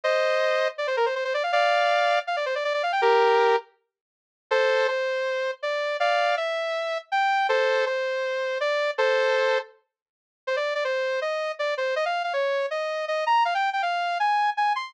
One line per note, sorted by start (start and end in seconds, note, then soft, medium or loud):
0.04 0.68 C5 medium
0.04 0.68 D#5 loud
0.78 0.87 D5 medium
0.87 0.96 C5 medium
0.97 1.06 A#4 medium
1.06 1.15 C5 medium
1.15 1.24 C5 medium
1.25 1.33 C5 medium
1.34 1.43 D5 medium
1.43 1.52 F5 medium
1.52 2.19 D5 medium
1.52 2.19 F5 loud
2.27 2.36 F5 medium
2.36 2.45 D5 medium
2.46 2.55 C5 medium
2.55 2.64 D5 medium
2.64 2.73 D5 medium
2.74 2.82 D5 medium
2.83 2.92 F5 medium
2.92 3.01 G5 medium
3.02 3.56 G4 medium
3.02 3.56 A#4 loud
4.51 4.87 A4 loud
4.51 4.87 C5 loud
4.88 5.51 C5 medium
5.63 5.97 D5 medium
6.00 6.35 D5 medium
6.00 6.35 F5 medium
6.37 6.98 E5 medium
7.12 7.47 G5 medium
7.49 7.85 A4 medium
7.49 7.85 C5 loud
7.86 8.58 C5 medium
8.60 8.91 D5 medium
8.98 9.58 A4 medium
8.98 9.58 C5 loud
10.47 10.56 C5 medium
10.56 10.74 D5 medium
10.75 10.84 D5 medium
10.84 11.20 C5 medium
11.22 11.52 D#5 medium
11.59 11.74 D5 medium
11.77 11.95 C5 medium
11.96 12.05 D#5 loud
12.05 12.23 F5 medium
12.24 12.33 F5 medium
12.33 12.66 C#5 medium
12.71 13.05 D#5 medium
13.08 13.24 D#5 medium
13.26 13.43 A#5 medium
13.45 13.54 F5 medium
13.55 13.70 G5 medium
13.73 13.82 G5 medium
13.82 14.18 F5 medium
14.20 14.50 G#5 medium
14.57 14.73 G#5 medium
14.76 14.93 C6 medium